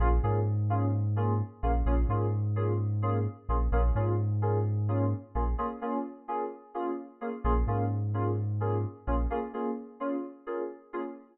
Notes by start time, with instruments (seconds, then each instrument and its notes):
0.00 synth bass 2 A#1, electric piano 2 A#3 C#4 F4 G#4
0.23 synth bass 2 G#2, electric piano 2 A#3 C#4 F4 G#4
0.70 electric piano 2 A#3 C#4 F4 G#4
1.16 electric piano 2 A#3 C#4 F4 G#4
1.63 synth bass 2 A#1, electric piano 2 A#3 C#4 F4 G#4
1.86 synth bass 2 A#1, electric piano 2 A#3 C#4 F4 G#4
2.09 synth bass 2 G#2, electric piano 2 A#3 C#4 F4 G#4
2.56 electric piano 2 A#3 C#4 F4 G#4
3.02 electric piano 2 A#3 C#4 F4 G#4
3.49 synth bass 2 A#1, electric piano 2 A#3 C#4 F4 G#4
3.72 synth bass 2 A#1, electric piano 2 A#3 C#4 F4 G#4
3.95 synth bass 2 G#2, electric piano 2 A#3 C#4 F4 G#4
4.42 electric piano 2 A#3 C#4 F4 G#4
4.88 electric piano 2 A#3 C#4 F4 G#4
5.35 synth bass 2 A#1, electric piano 2 A#3 C#4 F4 G#4
5.58 electric piano 2 A#3 C#4 F4 G#4
5.81 electric piano 2 A#3 C#4 F4 G#4
6.28 electric piano 2 A#3 C#4 F4 G#4
6.74 electric piano 2 A#3 C#4 F4 G#4
7.21 electric piano 2 A#3 C#4 F4 G#4
7.44 synth bass 2 A#1, electric piano 2 A#3 C#4 F4 G#4
7.67 synth bass 2 G#2, electric piano 2 A#3 C#4 F4 G#4
8.14 electric piano 2 A#3 C#4 F4 G#4
8.60 electric piano 2 A#3 C#4 F4 G#4
9.07 synth bass 2 A#1, electric piano 2 A#3 C#4 F4 G#4
9.30 electric piano 2 A#3 C#4 F4 G#4
9.53 electric piano 2 A#3 C#4 F4 G#4
10.00 electric piano 2 A#3 C#4 F4 G#4
10.47 electric piano 2 A#3 C#4 F4 G#4
10.93 electric piano 2 A#3 C#4 F4 G#4